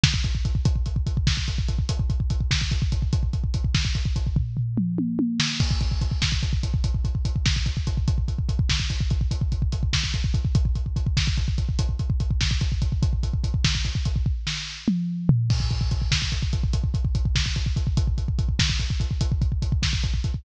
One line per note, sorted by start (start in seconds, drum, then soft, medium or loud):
0.04 kick medium
0.04 snare medium
0.14 kick medium
0.24 kick medium
0.24 closed hi-hat medium
0.35 kick medium
0.45 kick medium
0.45 closed hi-hat medium
0.55 kick medium
0.65 kick loud
0.65 closed hi-hat medium
0.76 kick medium
0.86 kick medium
0.86 closed hi-hat medium
0.96 kick medium
1.07 kick medium
1.07 closed hi-hat medium
1.17 kick medium
1.27 kick medium
1.27 snare medium
1.37 kick medium
1.48 kick medium
1.48 closed hi-hat medium
1.58 kick medium
1.68 kick medium
1.68 closed hi-hat medium
1.79 kick medium
1.89 kick medium
1.89 closed hi-hat loud
1.99 kick medium
2.10 kick medium
2.10 closed hi-hat medium
2.20 kick medium
2.30 kick medium
2.30 closed hi-hat medium
2.41 kick medium
2.51 kick medium
2.51 snare loud
2.61 kick medium
2.71 kick medium
2.71 closed hi-hat medium
2.82 kick medium
2.92 kick medium
2.92 closed hi-hat medium
3.02 kick medium
3.13 kick medium
3.13 closed hi-hat medium
3.23 kick medium
3.33 kick medium
3.33 closed hi-hat medium
3.44 kick medium
3.54 kick medium
3.54 closed hi-hat medium
3.64 kick medium
3.75 kick medium
3.75 snare medium
3.85 kick medium
3.95 kick medium
3.95 closed hi-hat medium
4.05 kick medium
4.16 kick medium
4.16 closed hi-hat medium
4.27 kick medium
4.36 kick medium
4.36 floor tom medium
4.57 floor tom medium
4.77 mid tom medium
4.98 high tom medium
5.19 high tom medium
5.40 snare loud
5.60 kick medium
5.60 crash medium
5.71 kick medium
5.81 kick medium
5.81 closed hi-hat medium
5.91 kick medium
6.01 kick medium
6.01 closed hi-hat medium
6.11 kick medium
6.22 kick medium
6.22 snare medium
6.32 kick medium
6.43 kick medium
6.43 closed hi-hat medium
6.53 kick medium
6.63 kick medium
6.63 closed hi-hat medium
6.74 kick medium
6.84 kick medium
6.84 closed hi-hat medium
6.95 kick medium
7.05 kick medium
7.05 closed hi-hat medium
7.15 kick medium
7.25 kick medium
7.25 closed hi-hat medium
7.36 kick medium
7.46 kick medium
7.46 snare medium
7.56 kick medium
7.66 kick medium
7.66 closed hi-hat medium
7.77 kick medium
7.87 kick medium
7.87 closed hi-hat medium
7.97 kick medium
8.08 kick medium
8.08 closed hi-hat medium
8.18 kick medium
8.28 kick medium
8.28 closed hi-hat medium
8.39 kick medium
8.49 kick medium
8.49 closed hi-hat medium
8.59 kick medium
8.69 kick medium
8.69 snare loud
8.80 kick medium
8.90 kick medium
8.90 closed hi-hat medium
9.01 kick medium
9.10 kick medium
9.10 closed hi-hat medium
9.21 kick medium
9.31 kick medium
9.31 closed hi-hat medium
9.41 kick medium
9.52 kick medium
9.52 closed hi-hat medium
9.62 kick medium
9.72 kick medium
9.72 closed hi-hat medium
9.83 kick medium
9.93 kick medium
9.93 snare loud
10.04 kick medium
10.14 kick medium
10.14 closed hi-hat medium
10.24 kick medium
10.34 kick medium
10.34 closed hi-hat medium
10.45 kick medium
10.55 kick loud
10.55 closed hi-hat medium
10.65 kick medium
10.75 kick medium
10.75 closed hi-hat medium
10.86 kick medium
10.96 kick medium
10.96 closed hi-hat medium
11.07 kick medium
11.17 kick medium
11.17 snare medium
11.27 kick medium
11.37 kick medium
11.37 closed hi-hat medium
11.48 kick medium
11.58 kick medium
11.58 closed hi-hat medium
11.69 kick medium
11.79 kick medium
11.79 closed hi-hat loud
11.89 kick medium
11.99 kick medium
11.99 closed hi-hat medium
12.10 kick medium
12.20 kick medium
12.20 closed hi-hat medium
12.31 kick medium
12.41 kick medium
12.41 snare medium
12.51 kick medium
12.61 kick medium
12.61 closed hi-hat medium
12.72 kick medium
12.82 kick medium
12.82 closed hi-hat medium
12.92 kick medium
13.03 kick medium
13.03 closed hi-hat medium
13.13 kick medium
13.23 kick medium
13.23 closed hi-hat medium
13.34 kick medium
13.44 kick medium
13.44 closed hi-hat medium
13.54 kick medium
13.65 kick medium
13.65 snare loud
13.75 kick medium
13.85 kick medium
13.85 closed hi-hat medium
13.95 kick medium
14.05 kick medium
14.05 closed hi-hat medium
14.16 kick medium
14.26 kick medium
14.47 snare medium
14.88 mid tom medium
15.29 floor tom loud
15.50 kick medium
15.50 crash loud
15.60 kick medium
15.70 kick medium
15.70 closed hi-hat medium
15.81 kick medium
15.91 kick medium
15.91 closed hi-hat medium
16.02 kick medium
16.12 kick medium
16.12 snare loud
16.22 kick medium
16.32 kick medium
16.32 closed hi-hat medium
16.43 kick medium
16.53 kick medium
16.53 closed hi-hat medium
16.64 kick medium
16.73 kick medium
16.73 closed hi-hat medium
16.84 kick medium
16.94 kick medium
16.94 closed hi-hat medium
17.05 kick medium
17.15 kick medium
17.15 closed hi-hat medium
17.25 kick medium
17.35 kick medium
17.35 snare loud
17.46 kick medium
17.56 kick medium
17.56 closed hi-hat medium
17.66 kick medium
17.76 kick medium
17.76 closed hi-hat medium
17.87 kick medium
17.97 kick medium
17.97 closed hi-hat medium
18.07 kick medium
18.18 kick medium
18.18 closed hi-hat medium
18.28 kick medium
18.39 kick medium
18.39 closed hi-hat medium
18.49 kick medium
18.59 kick medium
18.59 snare loud
18.70 kick medium
18.80 kick medium
18.80 closed hi-hat medium
18.90 kick medium
19.00 kick medium
19.00 closed hi-hat medium
19.11 kick medium
19.21 kick medium
19.21 closed hi-hat medium
19.32 kick medium
19.42 kick medium
19.42 closed hi-hat medium
19.52 kick medium
19.62 kick medium
19.62 closed hi-hat medium
19.72 kick medium
19.82 kick medium
19.82 snare medium
19.93 kick medium
20.03 kick medium
20.03 closed hi-hat medium
20.14 kick medium
20.24 kick medium
20.24 closed hi-hat medium
20.34 kick medium